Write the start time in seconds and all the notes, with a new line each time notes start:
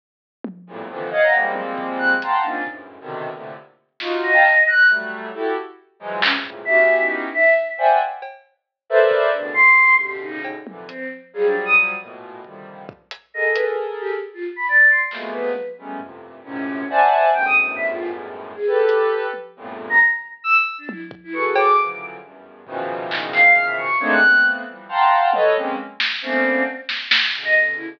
0.44 high tom
0.67 E2 F2 G2 A2 A#2
0.89 A#2 C3 D3 D#3 E3 F3
1.11 C#5 D#5 F5 F#5
1.23 A#5
1.33 F3 G3 G#3 A#3 C4, cowbell
1.56 high tom
1.78 kick
1.98 F#6
2.22 F5 F#5 G5 A5 A#5 C6, closed hi-hat
2.43 A#3 C4 C#4 D4 D#4 F4
2.67 F#2 G2 G#2 A2 A#2, kick
3.00 B2 C3 D3 D#3
3.33 A2 A#2 C3 D3
4.00 D#4 F4 F#4, snare
4.23 D#5
4.33 F5 G5 A5 A#5
4.44 clap
4.67 F#6
4.88 F#3 G3 A3, closed hi-hat
5.34 E4 F#4 G4 A4
6.00 E3 F3 F#3 G#3
6.22 F2 G2 G#2 A#2 C3 C#3 C#4, clap
6.44 G2 A2 A#2 C3 C#3, floor tom
6.65 B3 C#4 D#4 E4 F#4 G4 E5
6.99 D#4
7.34 E5
7.78 C5 D5 E5 F#5 G5 G#5
8.22 cowbell
8.90 A4 A#4 B4 C5 D5 E5
9.11 kick
9.32 A2 B2 C#3 D3 D4
9.54 C6
9.78 kick
9.99 G4
10.21 D#4
10.44 cowbell
10.67 A#2 C3 D3 E3, high tom
10.87 C4, closed hi-hat
11.33 F3 F#3 G3 G#4
11.46 D4
11.65 D#6
12.00 A2 A#2 B2
12.44 A#2 C3 D3 D#3 F3 G3, kick
12.89 kick
13.11 closed hi-hat
13.34 G#4 A4 A#4 D#5
13.54 B4, closed hi-hat
14.00 G4
14.34 F4
14.56 B5
14.68 D5
14.89 C6
15.11 F3 F#3 G#3 A3 A#3 B3, clap
15.32 B4
15.56 high tom
15.78 F#3 G3 G#3 A3 B3 C#4
16.00 F2 G2 A2 A#2 C3, floor tom
16.44 F#2 G#2 A2 A#2 C3 C#4
16.89 C5 D5 E5 F#5 G#5 A5
17.32 E2 F#2 G2 G#2 A2 G5
17.45 D#6
17.76 E5
17.89 F4
18.56 G#4
18.67 G4 A4 B4
18.89 closed hi-hat
19.33 high tom
19.56 E2 F2 G2 A2 A#2
19.90 A#5
20.44 E6
20.78 D4
20.89 E4, high tom
21.11 kick
21.24 E4
21.33 F#4 G#4 A4 B4 C#6
21.56 D6, cowbell
21.77 C#3 D3 E3 F3 F#3
22.22 E2 F#2 G2
22.66 A#2 B2 C#3 D#3 E3 F3, floor tom
23.11 D#4, clap
23.33 F5, clap
23.55 F6, closed hi-hat
23.66 E5
23.77 C#6
23.99 G#3 A3 A#3 C4 D4 D#4 C#5
24.11 F#6
24.22 A3 A#3 B3 C4
24.67 E3 F3 G3
24.89 F5 F#5 G5 A5 A#5 C6
25.33 A4 B4 C#5 D#5, high tom
25.56 G#3 A#3 C4 C#4
26.00 snare
26.22 A3 A#3 B3 C4 C#4 D4
26.89 snare
27.11 snare
27.33 B2 C#3 D3
27.45 D#5
27.76 E4